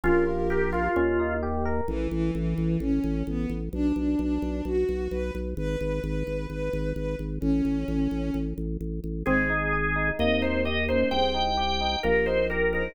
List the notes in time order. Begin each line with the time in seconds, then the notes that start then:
0.04 A#1 C#4 F4 G4 A#4
0.27 F4
0.50 G4 A#4
0.72 F4
0.96 D#2 C#4
1.19 D#4
1.43 G4
1.65 A#4
1.87 A1 E3
2.11 A1 E3
2.35 A1 E3
2.58 A1
2.80 A1 C#4
3.04 A1
3.27 A1 B3
3.50 A1
3.73 B1 D4
3.96 B1 D4
4.19 B1 D4
4.42 B1
4.65 B1 F#4
4.89 B1
5.11 B1 B4
5.35 B1
5.57 G#1 B4
5.80 G#1 B4
6.03 G#1 B4
6.27 G#1
6.50 G#1 B4
6.73 G#1
6.95 G#1 B4
7.19 G#1
7.40 A1 C#4
7.65 A1
7.88 A1
8.11 A1
8.34 A1
8.58 A1
8.81 A1
9.04 A1
9.25 G#1 G#3 C4 G#4
9.50 D#4
9.73 G#4
9.96 D#4
10.17 D#2 A#3 C4 D#4 D#5
10.42 D#4 C5
10.65 G4 D#5
10.88 A#3 C#4 D#4 C5
11.11 C2 C4 G#4 C5 G5
11.34 D#4
11.57 G4
11.81 D#4
12.03 A#1 A#3 G4 A#4
12.26 D#4 C5
12.50 G4 A#4
12.73 D#4 G#4 A#4 C5